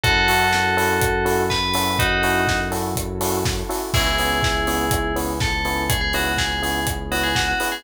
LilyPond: <<
  \new Staff \with { instrumentName = "Tubular Bells" } { \time 4/4 \key cis \minor \tempo 4 = 123 <fis' a'>2. b'4 | <dis' fis'>4. r2 r8 | <e' gis'>2. a'4 | gis'16 gis'16 fis'8 gis'4 r8 fis'16 gis'16 fis'16 fis'8 gis'16 | }
  \new Staff \with { instrumentName = "Electric Piano 2" } { \time 4/4 \key cis \minor <cis' e' fis' a'>8 <cis' e' fis' a'>4 <cis' e' fis' a'>4 <cis' e' fis' a'>4 <cis' e' fis' a'>8~ | <cis' e' fis' a'>8 <cis' e' fis' a'>4 <cis' e' fis' a'>4 <cis' e' fis' a'>4 <cis' e' fis' a'>8 | <b cis' e' gis'>8 <b cis' e' gis'>4 <b cis' e' gis'>4 <b cis' e' gis'>4 <b cis' e' gis'>8~ | <b cis' e' gis'>8 <b cis' e' gis'>4 <b cis' e' gis'>4 <b cis' e' gis'>4 <b cis' e' gis'>8 | }
  \new Staff \with { instrumentName = "Synth Bass 1" } { \clef bass \time 4/4 \key cis \minor fis,1~ | fis,1 | cis,1~ | cis,1 | }
  \new Staff \with { instrumentName = "Pad 2 (warm)" } { \time 4/4 \key cis \minor <cis' e' fis' a'>1~ | <cis' e' fis' a'>1 | <b cis' e' gis'>1~ | <b cis' e' gis'>1 | }
  \new DrumStaff \with { instrumentName = "Drums" } \drummode { \time 4/4 <hh bd>8 hho8 sn8 hho8 <hh bd>8 hho8 <bd sn>8 hho8 | <hh bd>8 hho8 <bd sn>8 hho8 <hh bd>8 hho8 <bd sn>8 hho8 | <cymc bd>8 hho8 <bd sn>8 hho8 <hh bd>8 hho8 <bd sn>8 hho8 | <hh bd>8 hho8 <bd sn>8 hho8 <hh bd>8 hho8 <bd sn>8 hho8 | }
>>